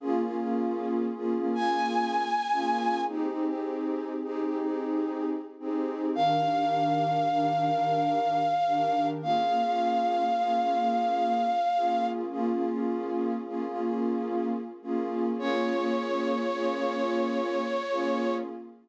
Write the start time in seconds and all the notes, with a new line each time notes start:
0.00 A#3 C#4 F4 G#4
0.21 A#3 C#4 F4 G#4
0.38 A#3 C#4 F4 G#4
1.15 A#3 C#4 F4 G#4
1.36 A#3 C#4 F4 G#4
1.54 A#3 C#4 F4 G#4 G#5
2.52 A#3 C#4 F4 G#4
3.08 C4 D#4 G4 G#4
3.29 C4 D#4 G4 G#4
3.46 C4 D#4 G4 G#4
4.23 C4 D#4 G4 G#4
4.44 C4 D#4 G4 G#4
4.62 C4 D#4 G4 G#4
5.60 C4 D#4 G4 G#4
6.15 D#3 D4 G4 A#4 F5
6.36 D#3 D4 G4 A#4
6.54 D#3 D4 G4 A#4
7.31 D#3 D4 G4 A#4
7.52 D#3 D4 G4 A#4
7.69 D#3 D4 G4 A#4
8.67 D#3 D4 G4 A#4
9.22 A#3 C#4 F4 G#4 F5
9.44 A#3 C#4 F4 G#4
9.62 A#3 C#4 F4 G#4
10.38 A#3 C#4 F4 G#4
10.60 A#3 C#4 F4 G#4
10.77 A#3 C#4 F4 G#4
11.75 A#3 C#4 F4 G#4
12.31 A#3 C#4 F4 G#4
12.52 A#3 C#4 F4 G#4
12.69 A#3 C#4 F4 G#4
13.46 A#3 C#4 F4 G#4
13.67 A#3 C#4 F4 G#4
13.84 A#3 C#4 F4 G#4
14.82 A#3 C#4 F4 G#4
15.39 A#3 C#4 F4 G#4 C#5
15.60 A#3 C#4 F4 G#4
15.77 A#3 C#4 F4 G#4
16.54 A#3 C#4 F4 G#4
16.75 A#3 C#4 F4 G#4
16.93 A#3 C#4 F4 G#4
17.90 A#3 C#4 F4 G#4